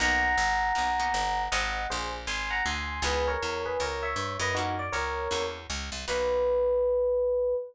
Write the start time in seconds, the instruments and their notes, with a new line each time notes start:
0.00 electric bass (finger) B1, acoustic guitar (steel) A#3 B3 D#4 F#4, electric piano 1 F#5 A#5
0.38 electric bass (finger) G#1
0.75 electric bass (finger) B1, acoustic guitar (steel) A#3 B3 D#4 F#4
1.00 acoustic guitar (steel) A#3 B3 D#4 F#4
1.14 electric bass (finger) G1
1.52 electric bass (finger) G#1, acoustic guitar (steel) G#3 C4 F4 F#4, electric piano 1 D#5 F#5
1.90 electric bass (finger) A#1, electric piano 1 G#4 C5
2.27 electric bass (finger) G#1, electric piano 1 G#5 C6
2.50 electric piano 1 F#5 A#5
2.65 electric bass (finger) D2, electric piano 1 G#5 C6
3.02 electric bass (finger) C#2, acoustic guitar (steel) B3 C#4 D#4 E4, electric piano 1 G#4 B4
3.28 electric piano 1 A#4 C#5
3.42 electric bass (finger) E2
3.66 electric piano 1 G#4 B4
3.80 electric bass (finger) C#2, electric piano 1 A#4 C#5
4.03 electric piano 1 C#5 E5
4.16 electric bass (finger) G2
4.39 electric bass (finger) F#2, electric piano 1 B4 D#5
4.55 acoustic guitar (steel) A#3 C#4 E4 F#4, electric piano 1 D#4 F#4
4.79 electric piano 1 D5
4.92 electric bass (finger) C#2, electric piano 1 A#4 C#5
5.31 electric bass (finger) E2, acoustic guitar (steel) A#3 C#4 E4 F#4
5.70 electric bass (finger) C#2
5.92 electric bass (finger) C2
6.08 electric bass (finger) B1, acoustic guitar (steel) A#3 B3 D#4 F#4, electric piano 1 B4